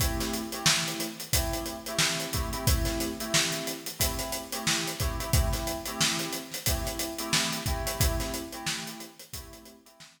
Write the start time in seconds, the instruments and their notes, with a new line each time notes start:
0.00 electric piano 2 A3 C4 E4 G4, kick, closed hi-hat
0.20 snare, closed hi-hat
0.33 closed hi-hat
0.52 electric piano 2 A3 C4 E4 G4, closed hi-hat
0.66 snare
0.88 closed hi-hat
1.00 closed hi-hat
1.20 closed hi-hat
1.33 electric piano 2 A3 C4 E4 G4, kick, closed hi-hat
1.53 closed hi-hat
1.66 closed hi-hat
1.86 electric piano 2 A3 C4 E4 G4, closed hi-hat
1.99 snare
2.20 closed hi-hat
2.33 electric piano 2 A3 C4 E4 G4, kick, closed hi-hat
2.53 electric piano 2 A3 C4 E4 G4, closed hi-hat
2.67 electric piano 2 A3 C4 E4 G4, kick, closed hi-hat
2.85 snare, closed hi-hat
3.00 snare, closed hi-hat
3.20 electric piano 2 A3 C4 E4 G4, closed hi-hat
3.34 snare
3.52 closed hi-hat
3.67 closed hi-hat
3.86 closed hi-hat
3.99 electric piano 2 A3 C4 E4 G4, kick, closed hi-hat
4.19 snare, closed hi-hat
4.32 closed hi-hat
4.52 electric piano 2 A3 C4 E4 G4, closed hi-hat
4.67 snare
4.87 closed hi-hat
5.00 electric piano 2 A3 C4 E4 G4, kick, closed hi-hat
5.19 electric piano 2 A3 C4 E4 G4, closed hi-hat
5.33 electric piano 2 A3 C4 E4 G4, kick, closed hi-hat
5.53 snare, closed hi-hat
5.67 closed hi-hat
5.86 electric piano 2 A3 C4 E4 G4, closed hi-hat
6.01 snare
6.19 snare, closed hi-hat
6.33 closed hi-hat
6.52 snare, closed hi-hat
6.66 electric piano 2 A3 C4 E4 G4, kick, closed hi-hat
6.85 snare, closed hi-hat
6.99 closed hi-hat
7.18 electric piano 2 A3 C4 E4 G4, closed hi-hat
7.33 snare, closed hi-hat
7.53 closed hi-hat
7.66 electric piano 2 A3 C4 E4 G4, kick, closed hi-hat
7.86 electric piano 2 A3 C4 E4 G4, snare, closed hi-hat
8.00 electric piano 2 A3 C4 E4 G4, kick, closed hi-hat
8.20 snare, closed hi-hat
8.34 closed hi-hat
8.53 electric piano 2 A3 C4 E4 G4, closed hi-hat
8.67 snare
8.87 closed hi-hat
9.00 closed hi-hat
9.19 closed hi-hat
9.33 electric piano 2 A3 C4 E4 G4, kick, closed hi-hat
9.53 closed hi-hat
9.65 closed hi-hat
9.85 electric piano 2 A3 C4 E4 G4, closed hi-hat
10.00 snare
10.19 closed hi-hat